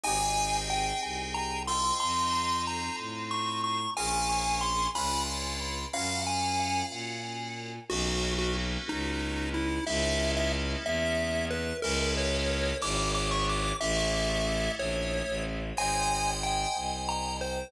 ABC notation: X:1
M:6/8
L:1/16
Q:3/8=61
K:Abmix
V:1 name="Lead 1 (square)"
a4 =g2 z2 b2 c'2 | c'4 b2 z2 d'2 d'2 | a4 c'2 _c'2 z4 | f2 a4 z6 |
[K:Bmix] F3 F z2 D4 E2 | e3 e z2 e4 B2 | ^A2 c4 =d'2 d' c' d'2 | e6 c4 z2 |
[K:Abmix] a4 =g2 z2 b2 c2 |]
V:2 name="Electric Piano 2"
[CE=GA]10 [CEF=A]2- | [CEF=A]12 | [DFAB]6 [D=DF_c]6 | [DFGB]12 |
[K:Bmix] [^A,B,CD]12 | [G,^A,CE]12 | [G,^A,CE]6 [F,G,=DE]6 | [G,A,CE]12 |
[K:Abmix] [ce=ga]12 |]
V:3 name="Violin" clef=bass
A,,,6 C,,6 | F,,6 =A,,6 | B,,,6 D,,6 | G,,6 B,,6 |
[K:Bmix] B,,,6 C,,6 | C,,6 E,,6 | C,,6 G,,,6 | A,,,6 ^A,,,3 =A,,,3 |
[K:Abmix] A,,,6 C,,6 |]